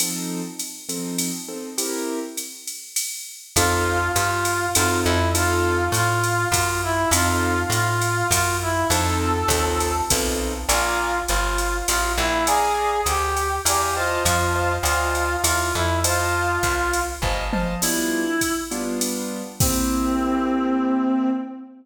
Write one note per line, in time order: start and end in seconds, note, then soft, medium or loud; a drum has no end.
0.00 0.41 F3 medium
0.00 0.41 C4 medium
0.00 0.41 D#4 medium
0.00 0.41 A4 medium
0.00 ride loud
0.59 hi-hat pedal medium
0.59 ride medium
0.89 1.30 F3 medium
0.89 1.30 C4 medium
0.89 1.30 D#4 medium
0.89 1.30 A4 medium
0.89 ride medium
1.18 ride loud
1.48 1.69 F3 medium
1.48 1.69 C4 medium
1.48 1.69 D#4 medium
1.48 1.69 A4 medium
1.78 2.19 C4 medium
1.78 2.19 E4 medium
1.78 2.19 G4 medium
1.78 2.19 A#4 medium
1.78 ride loud
2.37 hi-hat pedal medium
2.37 ride medium
2.67 ride medium
2.96 ride loud
3.56 4.10 F2 medium
3.56 3.99 C4 loud
3.56 3.99 D#4 loud
3.56 4.12 F4 medium
3.56 3.99 F4 loud
3.56 3.99 A4 loud
3.56 kick medium
3.56 ride loud
4.16 4.69 G2 medium
4.16 4.66 F4 medium
4.16 hi-hat pedal loud
4.16 ride medium
4.45 ride medium
4.75 5.05 F#2 medium
4.75 5.18 C4 loud
4.75 5.18 D#4 loud
4.75 5.00 F4 medium
4.75 5.18 F4 medium
4.75 5.18 A4 loud
4.75 ride loud
5.04 5.89 F2 medium
5.04 5.30 E4 medium
5.35 5.76 C4 loud
5.35 5.76 D#4 loud
5.35 5.76 F4 loud
5.35 5.85 F4 medium
5.35 5.76 A4 loud
5.35 ride loud
5.92 6.46 A2 medium
5.92 6.48 F4 medium
5.92 hi-hat pedal medium
5.92 ride loud
6.24 ride medium
6.52 7.05 F#2 medium
6.52 6.81 F4 medium
6.52 kick medium
6.52 ride loud
6.83 7.09 E4 medium
7.11 7.65 F2 medium
7.11 7.55 C4 loud
7.11 7.55 D#4 loud
7.11 7.63 F4 medium
7.11 7.55 F4 loud
7.11 7.55 A4 loud
7.11 ride loud
7.70 8.23 A2 medium
7.70 8.27 F4 medium
7.70 hi-hat pedal medium
7.70 ride medium
8.01 ride medium
8.31 8.84 F#2 medium
8.31 8.57 F4 medium
8.31 kick medium
8.31 ride loud
8.62 8.88 E4 medium
8.90 9.44 F2 medium
8.90 9.32 C4 loud
8.90 9.32 D#4 loud
8.90 9.32 F4 loud
8.90 9.32 A4 loud
8.90 9.92 A4 medium
8.90 ride loud
9.48 10.02 D#2 medium
9.48 9.93 C4 medium
9.48 9.93 D#4 loud
9.48 9.93 F4 medium
9.48 9.93 A4 loud
9.48 kick medium
9.48 hi-hat pedal loud
9.48 ride loud
9.80 ride medium
10.10 10.65 B1 medium
10.10 10.52 C4 medium
10.10 10.52 D#4 medium
10.10 10.52 F4 medium
10.10 10.52 A4 loud
10.10 kick medium
10.10 ride loud
10.69 11.22 A#1 medium
10.69 11.19 F4 medium
10.69 11.10 D5 loud
10.69 11.10 F5 medium
10.69 11.10 G#5 loud
10.69 11.10 A#5 loud
10.69 ride loud
11.28 11.83 G1 medium
11.28 11.78 F4 medium
11.28 hi-hat pedal medium
11.28 ride medium
11.58 ride medium
11.88 12.17 A1 medium
11.88 12.12 F4 medium
11.88 ride loud
12.17 13.01 A#1 medium
12.17 12.44 E4 medium
12.46 13.01 G#4 medium
12.46 12.90 D5 loud
12.46 12.90 F5 loud
12.46 12.90 G#5 loud
12.46 12.90 A#5 loud
12.46 ride loud
13.06 13.59 D2 medium
13.06 13.56 G4 medium
13.06 hi-hat pedal medium
13.06 ride medium
13.37 ride medium
13.65 14.19 E2 medium
13.65 13.94 G4 medium
13.65 13.94 D5 loud
13.65 13.94 F5 medium
13.65 13.94 G#5 medium
13.65 13.94 A#5 medium
13.65 ride loud
13.96 14.23 F4 medium
13.96 14.47 C5 loud
13.96 14.47 D#5 loud
13.96 14.47 F5 medium
13.96 14.47 A5 loud
14.25 14.79 F2 medium
14.25 14.73 F4 medium
14.25 kick medium
14.25 ride loud
14.55 14.76 C5 medium
14.55 14.76 D#5 medium
14.55 14.76 F5 medium
14.55 14.76 A5 medium
14.83 15.37 D2 medium
14.83 15.36 F4 medium
14.83 15.26 C5 medium
14.83 15.26 D#5 medium
14.83 15.26 F5 medium
14.83 15.26 A5 medium
14.83 hi-hat pedal medium
14.83 ride medium
15.15 ride medium
15.44 15.72 E2 medium
15.44 15.73 F4 medium
15.44 ride loud
15.74 16.58 F2 medium
15.74 15.99 E4 medium
16.04 17.00 F4 medium
16.04 16.46 C5 loud
16.04 16.46 D#5 loud
16.04 16.46 F5 loud
16.04 16.46 A5 loud
16.04 ride loud
16.63 17.16 C2 medium
16.63 kick medium
16.63 hi-hat pedal medium
16.63 ride medium
16.93 ride medium
17.22 17.75 G1 medium
17.22 17.44 C5 medium
17.22 17.44 D#5 medium
17.22 17.44 F5 medium
17.22 17.44 A5 medium
17.22 kick medium
17.53 17.74 C5 medium
17.53 17.74 D#5 medium
17.53 17.74 F5 medium
17.53 17.74 A5 medium
17.53 mid tom medium
17.82 18.24 G3 medium
17.82 18.24 B3 medium
17.82 18.24 D4 medium
17.82 18.54 E4 medium
17.82 18.24 F4 medium
17.82 crash loud
17.82 ride medium
18.41 kick medium
18.41 hi-hat pedal medium
18.41 ride medium
18.71 19.42 G3 medium
18.71 19.42 B3 medium
18.71 19.42 D4 medium
18.71 19.42 F4 medium
18.71 ride medium
19.01 ride medium
19.60 21.30 A#3 medium
19.60 21.30 C4 medium
19.60 21.30 C4 loud
19.60 21.30 E4 medium
19.60 21.30 G4 medium
19.60 kick loud
19.60 crash loud